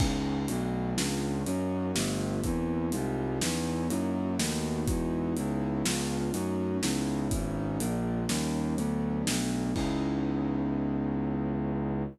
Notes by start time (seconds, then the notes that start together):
0.00 C#2 B3 C#4 D#4 E4, kick, crash
0.48 B1 A3 B3 D4 F#4, closed hi-hat
0.97 C#2 B3 C#4 D4 F4, snare
1.46 F#2 A#3 C#4 D#4 F#4, closed hi-hat
1.95 G1 A3 B3 F4 G4, snare
2.43 E2 A#3 C4 D4 E4, kick, closed hi-hat
2.92 C2 G3 G#3 D#4 F4, closed hi-hat
3.41 E2 B3 C#4 D#4 E4, snare
3.90 F#2 A#3 D#4 E4 F#4, closed hi-hat
4.38 D#2 A3 B3 D#4 F#4, snare
4.88 E2 G#3 D#4 E4 F#4, kick, closed hi-hat
5.36 C#2 B3 C#4 D#4 E4, closed hi-hat
5.85 C#2 B3 C#4 D4 F4, snare
6.33 F#2 A3 C#4 D#4 F#4, closed hi-hat
6.83 C#2 B3 C#4 D#4 E4, snare
7.31 G#1 B3 C#4 D#4 E4, kick, closed hi-hat
7.80 A#1 G#3 A#3 D4 F4, closed hi-hat
8.29 D#2 G3 A#3 C#4 D#4, snare
8.77 D2 F#3 A3 B3 D4, closed hi-hat
9.27 B1 F#3 A3 B3 D4, snare
9.76 C#2 B3 C#4 D#4 E4, kick, crash